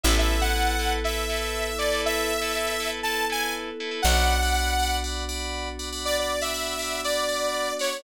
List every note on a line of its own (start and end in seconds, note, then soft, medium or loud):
0.03 3.72 A1 loud
0.03 4.00 B3 medium
0.03 4.00 E4 medium
0.03 0.36 E4 medium
0.03 4.00 A4 medium
0.03 0.36 A4 loud
0.03 0.36 B4 loud
0.03 0.15 E5 medium
0.19 0.41 E5 medium
0.41 0.52 E4 medium
0.41 0.52 A4 medium
0.41 0.52 B4 medium
0.41 0.92 F#5 medium
0.55 0.75 E4 medium
0.55 0.75 A4 medium
0.55 0.75 B4 medium
0.79 0.99 E4 medium
0.79 0.99 A4 medium
0.79 0.99 B4 medium
1.04 1.24 E4 medium
1.04 1.24 A4 medium
1.04 1.24 B4 medium
1.04 1.77 E5 medium
1.29 1.69 E4 medium
1.29 1.69 A4 medium
1.29 1.69 B4 medium
1.78 1.89 E4 medium
1.78 1.89 A4 medium
1.78 1.89 B4 medium
1.78 2.01 D5 medium
1.92 2.32 E4 medium
1.92 2.32 A4 medium
1.92 2.32 B4 loud
2.06 2.90 E5 medium
2.42 2.52 E4 medium
2.42 2.52 A4 loud
2.42 2.52 B4 medium
2.55 2.75 E4 medium
2.55 2.75 A4 medium
2.55 2.75 B4 medium
2.80 3.00 E4 medium
2.80 3.00 A4 medium
2.80 3.00 B4 medium
3.03 3.24 E4 medium
3.03 3.24 A4 medium
3.03 3.24 B4 medium
3.03 3.25 A5 medium
3.30 3.70 E4 medium
3.30 3.70 A4 medium
3.30 3.70 B4 medium
3.30 3.41 G#5 medium
3.41 3.53 G#5 medium
3.80 3.90 E4 medium
3.80 3.90 A4 medium
3.80 3.90 B4 medium
3.91 4.01 E4 medium
3.91 4.01 A4 medium
3.91 4.01 B4 medium
4.02 7.72 B1 medium
4.02 8.00 B3 medium
4.02 8.00 D4 medium
4.02 8.00 F#4 medium
4.02 4.34 D5 loud
4.02 4.97 F#5 medium
4.02 4.34 F#5 loud
4.02 4.34 B5 loud
4.42 4.53 D5 medium
4.42 4.53 F#5 loud
4.42 4.53 B5 medium
4.54 4.74 D5 medium
4.54 4.74 F#5 medium
4.54 4.74 B5 medium
4.79 4.99 D5 medium
4.79 4.99 F#5 medium
4.79 4.99 B5 medium
5.04 5.24 D5 medium
5.04 5.24 F#5 medium
5.04 5.24 B5 medium
5.29 5.69 D5 medium
5.29 5.69 F#5 medium
5.29 5.69 B5 loud
5.79 5.89 D5 medium
5.79 5.89 F#5 medium
5.79 5.89 B5 medium
5.92 6.32 D5 medium
5.92 6.32 F#5 medium
5.92 6.32 B5 loud
6.05 6.17 D5 medium
6.19 6.41 D5 medium
6.41 6.51 D5 medium
6.41 7.02 E5 medium
6.41 6.51 F#5 medium
6.41 6.51 B5 loud
6.54 6.74 D5 medium
6.54 6.74 F#5 medium
6.54 6.74 B5 loud
6.79 6.99 D5 medium
6.79 6.99 F#5 medium
6.79 6.99 B5 loud
7.04 7.24 D5 medium
7.04 7.73 D5 medium
7.04 7.24 F#5 medium
7.04 7.24 B5 medium
7.28 7.68 D5 medium
7.28 7.68 F#5 medium
7.28 7.68 B5 medium
7.79 8.01 C#5 medium
7.79 7.89 D5 loud
7.79 7.89 F#5 loud
7.79 7.89 B5 medium
7.92 8.02 D5 medium
7.92 8.02 F#5 loud
7.92 8.02 B5 medium